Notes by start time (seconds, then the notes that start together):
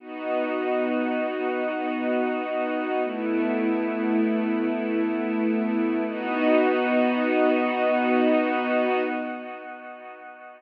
0.00 B3 D#4 F#4
3.04 A3 B3 E4
6.07 B3 D#4 F#4